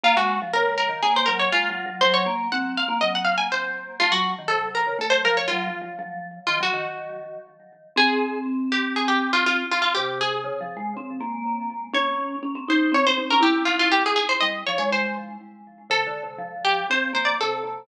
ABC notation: X:1
M:4/4
L:1/16
Q:1/4=121
K:Bbm
V:1 name="Pizzicato Strings"
F G2 z B2 B2 A c B d F4 | c d2 z g2 f2 e g f a c4 | F G2 z =A2 B2 A c B d F4 | z4 F G9 z2 |
[K:Fm] A4 z2 G2 A G2 F F2 F F | G2 A10 z4 | d4 z2 c2 d c2 B G2 F F | G A A c e2 d d c2 z6 |
[K:F] A6 G2 c2 c d A4 |]
V:2 name="Vibraphone"
B, A,2 F, D,3 E, B,2 G,2 (3A,2 G,2 G,2 | G,2 B,2 C3 B, G,4 z4 | =A, G,2 E, C,3 D, A,2 F,2 (3G,2 F,2 F,2 | F,4 E, G, E,6 z4 |
[K:Fm] C16 | C,4 (3D,2 F,2 A,2 C2 B,6 | D4 D C E2 C C C D =E4 | z4 G,2 F, A,5 z4 |
[K:F] (3C,2 D,2 C,2 F,4 C2 B,2 C,2 C,2 |]